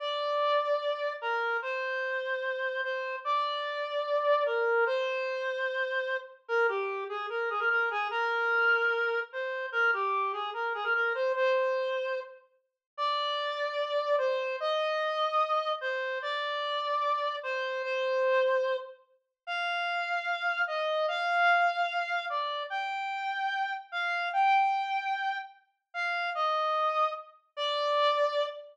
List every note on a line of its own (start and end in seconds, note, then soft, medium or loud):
0.00 1.13 D5 medium
1.21 1.57 A#4 medium
1.62 2.81 C5 medium
2.83 3.16 C5 medium
3.25 4.44 D5 medium
4.46 4.84 A#4 medium
4.86 6.17 C5 medium
6.48 6.67 A#4 medium
6.69 7.04 G4 medium
7.09 7.26 G#4 medium
7.30 7.49 A#4 medium
7.50 7.60 G#4 medium
7.59 7.69 A#4 medium
7.70 7.89 A#4 medium
7.91 8.08 G#4 medium
8.11 9.20 A#4 medium
9.33 9.66 C5 medium
9.72 9.91 A#4 medium
9.93 10.32 G4 medium
10.33 10.50 G#4 medium
10.54 10.73 A#4 medium
10.75 10.84 G#4 medium
10.84 10.93 A#4 medium
10.95 11.13 A#4 medium
11.15 11.32 C5 medium
11.35 12.20 C5 medium
12.97 14.16 D5 medium
14.18 14.56 C5 medium
14.60 15.72 D#5 medium
15.81 16.19 C5 medium
16.22 17.36 D5 medium
17.43 17.82 C5 medium
17.83 18.76 C5 medium
19.47 20.62 F5 medium
20.67 21.06 D#5 medium
21.08 22.25 F5 medium
22.30 22.63 D5 medium
22.70 23.73 G5 medium
23.92 24.29 F5 medium
24.33 25.38 G5 medium
25.94 26.30 F5 medium
26.35 27.10 D#5 medium
27.57 28.46 D5 medium